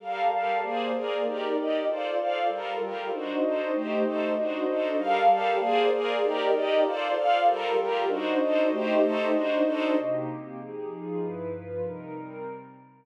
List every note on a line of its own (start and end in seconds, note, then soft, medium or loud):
0.00 0.29 G3 medium
0.00 0.62 G4 medium
0.00 0.29 A4 medium
0.00 0.31 A#4 medium
0.00 0.62 A#4 medium
0.00 0.29 F5 medium
0.00 0.62 F5 medium
0.00 0.62 A5 medium
0.30 0.61 G3 medium
0.30 0.61 G4 medium
0.30 0.61 A4 medium
0.30 0.61 F5 medium
0.62 1.23 A#3 medium
0.62 0.92 A#3 medium
0.62 1.23 G#4 medium
0.62 0.92 G#4 medium
0.62 1.23 C5 medium
0.62 0.94 C5 medium
0.62 1.23 D5 medium
0.62 0.92 D5 medium
0.93 1.24 A#3 medium
0.93 1.24 G#4 medium
0.93 1.24 A#4 medium
0.93 1.24 D5 medium
1.24 1.55 D#4 medium
1.24 1.87 D#4 medium
1.24 1.55 G4 medium
1.24 1.87 G4 medium
1.24 1.55 A#4 medium
1.24 1.87 A#4 medium
1.24 1.55 D5 medium
1.24 1.85 D5 medium
1.56 1.87 D#4 medium
1.56 1.87 G4 medium
1.56 1.87 D5 medium
1.56 1.87 D#5 medium
1.86 2.48 F4 medium
1.86 2.17 F4 medium
1.86 2.48 A4 medium
1.86 2.17 A4 medium
1.86 2.48 C5 medium
1.86 2.18 C5 medium
1.86 2.48 D5 medium
1.86 2.17 D5 medium
2.18 2.48 F4 medium
2.18 2.48 A4 medium
2.18 2.48 D5 medium
2.18 2.48 F5 medium
2.49 3.10 G3 medium
2.49 2.80 G3 medium
2.49 3.10 F4 medium
2.49 2.80 F4 medium
2.49 3.10 A4 medium
2.49 2.80 A4 medium
2.49 3.10 A#4 medium
2.49 2.80 A#4 medium
2.80 3.11 G3 medium
2.80 3.11 F4 medium
2.80 3.11 G4 medium
2.80 3.11 A#4 medium
3.10 3.71 D4 medium
3.10 3.41 D4 medium
3.10 3.41 D#4 medium
3.10 3.71 F#4 medium
3.10 3.42 F#4 medium
3.10 3.71 C5 medium
3.10 3.41 C5 medium
3.10 3.71 D#5 medium
3.42 3.73 D4 medium
3.42 3.73 D#4 medium
3.42 3.73 A4 medium
3.42 3.73 C5 medium
3.73 4.03 A3 medium
3.73 4.35 A3 medium
3.73 4.03 D#4 medium
3.73 4.04 G4 medium
3.73 4.35 G4 medium
3.73 4.03 C5 medium
3.73 4.35 C5 medium
3.73 4.35 D#5 medium
4.03 4.34 A3 medium
4.03 4.34 D#4 medium
4.03 4.34 A4 medium
4.03 4.34 C5 medium
4.35 4.66 D4 medium
4.35 4.97 D4 medium
4.35 4.66 D#4 medium
4.35 4.66 F#4 medium
4.35 4.97 F#4 medium
4.35 4.66 C5 medium
4.35 4.97 C5 medium
4.35 4.97 D#5 medium
4.67 4.98 D4 medium
4.67 4.98 D#4 medium
4.67 4.97 A4 medium
4.67 4.98 C5 medium
4.97 5.27 G3 medium
4.97 5.59 G4 medium
4.97 5.27 A4 medium
4.97 5.59 A#4 medium
4.97 5.29 A#4 medium
4.97 5.59 F5 medium
4.97 5.27 F5 loud
4.97 5.59 A5 medium
5.28 5.59 G3 medium
5.28 5.59 G4 medium
5.28 5.59 A4 medium
5.28 5.59 F5 medium
5.58 6.20 A#3 loud
5.58 5.90 A#3 loud
5.58 6.20 G#4 loud
5.58 5.90 G#4 loud
5.58 6.20 C5 medium
5.58 5.90 C5 medium
5.58 6.20 D5 medium
5.58 5.90 D5 loud
5.92 6.23 A#3 medium
5.92 6.23 G#4 loud
5.92 6.21 A#4 loud
5.92 6.21 D5 medium
6.21 6.83 D#4 medium
6.21 6.52 D#4 medium
6.21 6.83 G4 medium
6.21 6.52 G4 medium
6.21 6.83 A#4 medium
6.21 6.53 A#4 loud
6.21 6.83 D5 medium
6.21 6.52 D5 medium
6.52 6.83 D#4 medium
6.52 6.83 G4 medium
6.52 6.83 D5 medium
6.52 6.83 D#5 loud
6.83 7.14 F4 loud
6.83 7.45 F4 medium
6.83 7.14 A4 medium
6.83 7.45 A4 loud
6.83 7.14 C5 medium
6.83 7.45 C5 medium
6.83 7.14 D5 medium
6.83 7.45 D5 loud
7.15 7.46 F4 medium
7.15 7.46 A4 medium
7.15 7.46 D5 medium
7.15 7.46 F5 loud
7.46 8.07 G3 medium
7.46 7.77 G3 loud
7.46 8.07 F4 loud
7.46 7.77 F4 medium
7.46 8.07 A4 medium
7.46 7.78 A4 loud
7.46 8.07 A#4 medium
7.46 7.77 A#4 loud
7.77 8.08 G3 medium
7.77 8.08 F4 medium
7.77 8.08 G4 medium
7.77 8.08 A#4 medium
8.07 8.69 D4 medium
8.07 8.39 D4 medium
8.07 8.39 D#4 medium
8.07 8.69 F#4 medium
8.07 8.39 F#4 medium
8.07 8.69 C5 medium
8.07 8.39 C5 medium
8.07 8.69 D#5 loud
8.40 8.70 D4 medium
8.40 8.70 D#4 medium
8.40 8.70 A4 medium
8.40 8.70 C5 medium
8.71 9.33 A3 loud
8.71 9.01 A3 medium
8.71 9.01 D#4 medium
8.71 9.33 G4 loud
8.71 9.02 G4 medium
8.71 9.32 C5 medium
8.71 9.01 C5 loud
8.71 9.32 D#5 medium
9.01 9.32 A3 medium
9.01 9.32 D#4 loud
9.01 9.32 A4 loud
9.01 9.32 C5 medium
9.32 9.63 D4 medium
9.32 9.95 D4 medium
9.32 9.63 D#4 medium
9.32 9.63 F#4 medium
9.32 9.95 F#4 medium
9.32 9.63 C5 medium
9.32 9.95 C5 medium
9.32 9.95 D#5 loud
9.65 9.95 D4 loud
9.65 9.95 D#4 loud
9.65 9.95 A4 loud
9.65 9.95 C5 medium
9.96 10.26 C3 medium
9.96 10.26 A#3 medium
9.96 10.27 D#4 medium
9.96 10.26 G4 medium
10.26 10.57 C3 medium
10.26 10.57 A#3 medium
10.26 10.57 C4 medium
10.26 10.56 G4 medium
10.57 10.88 F3 medium
10.57 10.88 D#4 medium
10.57 10.88 G4 medium
10.57 10.88 G#4 medium
10.88 11.19 F3 medium
10.88 11.19 D#4 medium
10.88 11.19 F4 medium
10.88 11.19 G#4 medium
11.19 11.50 G2 medium
11.19 11.50 F3 medium
11.19 11.50 E4 medium
11.19 11.50 B4 medium
11.50 11.81 G2 medium
11.50 11.81 F3 medium
11.50 11.81 F4 medium
11.50 11.81 B4 medium
11.81 12.11 C3 medium
11.81 12.11 G3 medium
11.81 12.12 D#4 medium
11.81 12.11 A#4 medium
12.12 12.43 C3 medium
12.12 12.43 G3 medium
12.12 12.43 C4 medium
12.12 12.43 A#4 medium